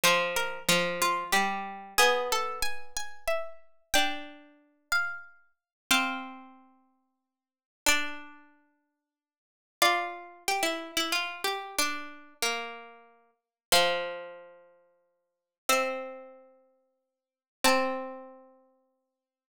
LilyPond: <<
  \new Staff \with { instrumentName = "Harpsichord" } { \time 3/4 \key f \major \tempo 4 = 92 c''8 bes'8 f'8 f'8 g'4 | gis'8 a'8 gis''8 gis''8 e''4 | g''4. f''4 r8 | f''2. |
d''2. | d''2. | d''2. | f''2. |
e''2. | a''2. | }
  \new Staff \with { instrumentName = "Harpsichord" } { \time 3/4 \key f \major f4 f4 g4 | b2. | d'4. r4. | c'2. |
d'2. | f'4 g'16 e'8 e'16 f'8 g'8 | d'4 bes4. r8 | f2. |
c'2. | c'2. | }
>>